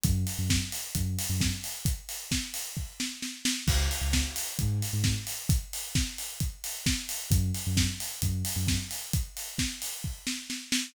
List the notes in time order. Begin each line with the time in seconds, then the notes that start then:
0.04 F#2, kick, closed hi-hat
0.27 open hi-hat
0.38 F#2
0.50 kick, snare
0.72 open hi-hat
0.95 F#2, kick, closed hi-hat
1.19 open hi-hat
1.29 F#2
1.41 kick, snare
1.64 open hi-hat
1.85 kick, closed hi-hat
2.09 open hi-hat
2.31 kick, snare
2.54 open hi-hat
2.77 kick
3.00 snare
3.22 snare
3.45 snare
3.67 C#2, kick, crash
3.91 open hi-hat
4.01 C#2
4.13 kick, snare
4.36 open hi-hat
4.59 G#2, kick, closed hi-hat
4.82 open hi-hat
4.93 G#2
5.04 kick, snare
5.27 open hi-hat
5.49 kick, closed hi-hat
5.73 open hi-hat
5.95 kick, snare
6.18 open hi-hat
6.40 kick, closed hi-hat
6.64 open hi-hat
6.86 kick, snare
7.09 open hi-hat
7.30 F#2, kick, closed hi-hat
7.54 open hi-hat
7.67 F#2
7.77 kick, snare
8.00 open hi-hat
8.22 F#2, kick, closed hi-hat
8.45 open hi-hat
8.56 F#2
8.67 kick, snare
8.91 open hi-hat
9.13 kick, closed hi-hat
9.37 open hi-hat
9.58 kick, snare
9.82 open hi-hat
10.04 kick
10.27 snare
10.50 snare
10.72 snare